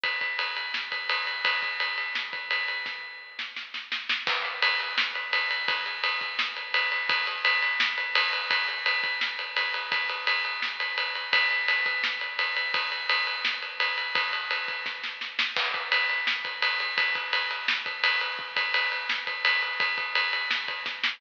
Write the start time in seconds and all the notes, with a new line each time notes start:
0.04 kick, ride
0.21 kick, ride
0.39 ride
0.56 ride
0.74 snare
0.92 kick, ride
1.09 ride
1.27 ride
1.45 kick, ride
1.62 kick, ride
1.80 ride
1.98 ride
2.15 snare
2.33 kick, ride
2.51 ride
2.68 ride
2.86 kick, snare
3.39 snare
3.56 snare
3.74 snare
3.92 snare
4.09 snare
4.27 kick, crash
4.45 ride
4.62 ride
4.80 ride
4.98 snare
5.15 ride
5.33 ride
5.51 ride
5.68 kick, ride
5.86 ride
6.04 ride
6.21 kick, ride
6.39 snare
6.56 ride
6.74 ride
6.92 ride
7.09 kick, ride
7.27 ride
7.45 ride
7.62 ride
7.80 snare
7.98 ride
8.15 ride
8.33 ride
8.51 kick, ride
8.68 ride
8.86 ride
9.04 kick, ride
9.21 snare
9.39 ride
9.56 ride
9.74 ride
9.92 kick, ride
10.09 ride
10.27 ride
10.45 ride
10.62 snare
10.80 ride
10.98 ride
11.15 ride
11.33 kick, ride
11.51 ride
11.68 ride
11.86 kick, ride
12.04 snare
12.21 ride
12.39 ride
12.56 ride
12.74 kick, ride
12.92 ride
13.09 ride
13.27 ride
13.45 snare
13.62 ride
13.80 ride
13.98 ride
14.15 kick, ride
14.33 ride
14.51 ride
14.68 kick, ride
14.86 kick, snare
15.04 snare
15.21 snare
15.39 snare
15.56 kick, crash
15.74 kick, ride
15.92 ride
16.09 ride
16.27 snare
16.45 kick, ride
16.62 ride
16.80 ride
16.98 kick, ride
17.15 kick, ride
17.33 ride
17.51 ride
17.68 snare
17.86 kick, ride
18.04 ride
18.21 ride
18.39 kick
18.56 kick, ride
18.74 ride
18.92 ride
19.09 snare
19.27 kick, ride
19.45 ride
19.62 ride
19.80 kick, ride
19.98 kick, ride
20.15 ride
20.33 ride
20.51 snare
20.68 kick, ride
20.86 kick, snare
21.04 snare